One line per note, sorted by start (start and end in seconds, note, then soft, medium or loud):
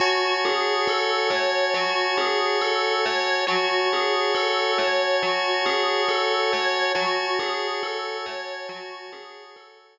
0.00 0.38 F#4 loud
0.00 3.45 F#4 medium
0.00 3.45 C#5 medium
0.00 3.45 G#5 medium
0.00 3.45 A5 medium
0.45 0.84 G#4 medium
0.87 1.27 A4 medium
1.30 1.69 C#5 medium
1.74 2.13 F#4 medium
2.18 2.57 G#4 medium
2.61 3.00 A4 medium
3.05 3.45 C#5 medium
3.47 3.86 F#4 medium
3.47 6.92 F#4 medium
3.47 6.92 C#5 medium
3.47 6.92 G#5 medium
3.47 6.92 A5 medium
3.93 4.32 G#4 medium
4.35 4.74 A4 medium
4.78 5.17 C#5 medium
5.23 5.62 F#4 medium
5.66 6.05 G#4 medium
6.09 6.48 A4 medium
6.53 6.92 C#5 medium
6.95 9.98 F#4 medium
6.95 7.34 F#4 medium
6.95 9.98 C#5 medium
6.95 9.98 G#5 medium
6.95 9.98 A5 medium
7.39 7.78 G#4 medium
7.83 8.22 A4 medium
8.26 8.65 C#5 medium
8.69 9.08 F#4 medium
9.12 9.52 G#4 medium
9.56 9.95 A4 medium